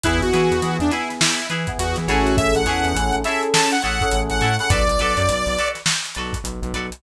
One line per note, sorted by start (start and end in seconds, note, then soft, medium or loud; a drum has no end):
0.03 0.21 E2 loud
0.03 0.29 B3 medium
0.03 0.21 E4 medium
0.03 0.29 E4 medium
0.03 0.17 E4 loud
0.03 0.29 G#4 medium
0.03 0.17 G#4 loud
0.03 0.17 B4 loud
0.03 kick medium
0.03 closed hi-hat loud
0.21 0.31 E2 medium
0.21 0.77 F#4 medium
0.21 closed hi-hat medium
0.33 0.50 E3 medium
0.33 0.57 B3 medium
0.33 0.57 E4 medium
0.33 0.56 E4 medium
0.33 0.57 G#4 medium
0.33 0.56 G#4 medium
0.33 0.56 B4 medium
0.33 snare soft
0.33 closed hi-hat medium
0.51 0.61 E2 medium
0.51 closed hi-hat medium
0.62 0.78 E3 medium
0.62 0.87 B3 medium
0.62 0.87 E4 medium
0.62 0.87 G#4 medium
0.62 closed hi-hat medium
0.79 0.90 E2 medium
0.79 0.91 D4 medium
0.79 closed hi-hat medium
0.91 1.40 B3 medium
0.91 1.40 E4 medium
0.91 1.09 E4 medium
0.91 1.14 E4 medium
0.91 1.40 G#4 medium
0.91 1.14 G#4 medium
0.91 1.14 B4 medium
0.91 closed hi-hat medium
1.10 snare soft
1.10 closed hi-hat medium
1.21 1.47 E4 medium
1.21 snare loud
1.38 closed hi-hat medium
1.50 1.66 E3 medium
1.50 1.72 E4 medium
1.50 1.72 G#4 medium
1.50 1.72 B4 medium
1.50 closed hi-hat medium
1.67 2.06 B3 medium
1.67 2.06 E4 medium
1.67 2.06 G#4 medium
1.67 kick medium
1.67 closed hi-hat medium
1.78 1.95 E2 medium
1.78 1.96 F#4 medium
1.78 closed hi-hat loud
1.96 2.07 E3 medium
1.96 snare soft
1.96 closed hi-hat medium
2.08 2.53 A1 medium
2.08 2.62 C#4 medium
2.08 2.62 E4 medium
2.08 2.50 E4 loud
2.08 2.36 F#4 medium
2.08 2.62 G#4 medium
2.08 2.50 G#4 loud
2.08 2.62 A4 medium
2.08 2.50 A4 loud
2.08 2.50 C#5 loud
2.08 closed hi-hat medium
2.26 snare soft
2.26 closed hi-hat medium
2.37 2.54 E5 medium
2.37 kick loud
2.37 closed hi-hat medium
2.55 2.65 A1 medium
2.55 3.16 F#5 medium
2.55 closed hi-hat medium
2.66 2.82 E2 medium
2.66 2.91 C#4 medium
2.66 2.91 E4 medium
2.66 2.89 E4 medium
2.66 2.91 G#4 medium
2.66 2.89 G#4 medium
2.66 2.91 A4 medium
2.66 2.89 A4 medium
2.66 2.89 C#5 medium
2.66 closed hi-hat medium
2.84 2.94 E2 medium
2.84 closed hi-hat medium
2.94 3.11 A1 medium
2.94 3.20 C#4 medium
2.94 3.20 E4 medium
2.94 3.20 G#4 medium
2.94 3.20 A4 medium
2.94 closed hi-hat loud
3.12 3.24 A1 medium
3.12 closed hi-hat medium
3.24 3.73 C#4 medium
3.24 3.73 E4 medium
3.24 3.47 E4 medium
3.24 3.73 G#4 medium
3.24 3.47 G#4 medium
3.24 3.73 A4 medium
3.24 3.47 A4 medium
3.24 3.47 C#5 medium
3.24 3.42 E5 medium
3.24 closed hi-hat medium
3.43 closed hi-hat medium
3.54 3.71 A5 medium
3.54 snare loud
3.72 3.82 F#5 medium
3.72 closed hi-hat medium
3.82 4.00 A1 medium
3.82 4.05 E4 medium
3.82 4.05 G#4 medium
3.82 4.05 A4 medium
3.82 4.05 C#5 medium
3.82 4.21 F#5 medium
3.82 closed hi-hat medium
4.01 4.45 C#4 medium
4.01 4.45 E4 medium
4.01 4.45 G#4 medium
4.01 4.45 A4 medium
4.01 kick medium
4.01 closed hi-hat medium
4.11 4.29 A1 medium
4.11 closed hi-hat medium
4.30 4.41 A1 medium
4.30 4.57 F#5 medium
4.30 closed hi-hat medium
4.41 4.58 A2 medium
4.41 4.54 E4 medium
4.41 4.54 G#4 medium
4.41 4.54 A4 medium
4.41 4.54 C#5 medium
4.41 closed hi-hat medium
4.59 4.68 C#4 medium
4.59 4.68 E4 medium
4.59 4.68 G#4 medium
4.59 4.68 A4 medium
4.59 4.70 F#5 medium
4.59 closed hi-hat medium
4.70 4.86 B1 medium
4.70 4.83 F#4 medium
4.70 4.83 A4 loud
4.70 4.83 B4 loud
4.70 4.83 D5 loud
4.70 5.69 D5 medium
4.70 kick loud
4.70 closed hi-hat loud
4.88 4.98 B1 medium
4.88 closed hi-hat medium
4.99 5.15 B1 medium
4.99 5.22 F#4 medium
4.99 5.22 A4 loud
4.99 5.22 B4 medium
4.99 5.22 D5 medium
4.99 closed hi-hat medium
5.17 5.27 F#2 medium
5.17 closed hi-hat medium
5.29 5.45 B1 medium
5.29 closed hi-hat medium
5.46 5.57 B1 medium
5.46 closed hi-hat medium
5.57 5.80 F#4 medium
5.57 5.80 A4 medium
5.57 5.80 B4 medium
5.57 5.80 D5 medium
5.57 closed hi-hat medium
5.75 snare soft
5.75 closed hi-hat medium
5.86 snare loud
6.05 closed hi-hat medium
6.15 6.33 B1 medium
6.15 6.39 A4 medium
6.15 6.39 B4 medium
6.15 6.39 D5 medium
6.15 closed hi-hat medium
6.19 6.39 F#4 medium
6.33 kick medium
6.33 closed hi-hat medium
6.44 6.60 B1 medium
6.44 closed hi-hat medium
6.62 6.72 B1 loud
6.62 closed hi-hat medium
6.74 6.90 B1 medium
6.74 6.87 F#4 medium
6.74 6.87 A4 medium
6.74 6.87 B4 medium
6.74 6.87 D5 medium
6.74 closed hi-hat medium
6.92 closed hi-hat medium